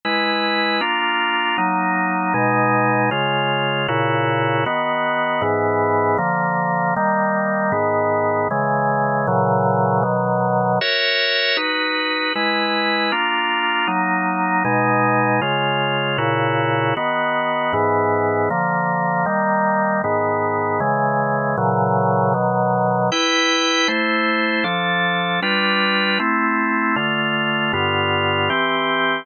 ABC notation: X:1
M:6/8
L:1/8
Q:3/8=78
K:B
V:1 name="Drawbar Organ"
[G,EB]3 [A,=D^E]3 | [F,A,D]3 [B,,G,D]3 | [C,G,^E]3 [A,,C,=EF]3 | [D,B,F]3 [G,,E,B,]3 |
[=D,^E,A,]3 [^D,=G,A,]3 | [G,,D,B,]3 [C,E,G,]3 | [A,,C,E,F,]3 [B,,D,F,]3 | [FAce]3 [DFB]3 |
[G,EB]3 [A,=D^E]3 | [F,A,D]3 [B,,G,D]3 | [C,G,^E]3 [A,,C,=EF]3 | [D,B,F]3 [G,,E,B,]3 |
[=D,^E,A,]3 [^D,=G,A,]3 | [G,,D,B,]3 [C,E,G,]3 | [A,,C,E,F,]3 [B,,D,F,]3 | [K:C] [EBg]3 [A,Ec]3 |
[F,DA]3 [G,DFB]3 | [A,CE]3 [D,A,F]3 | [G,,D,B,F]3 [E,CG]3 |]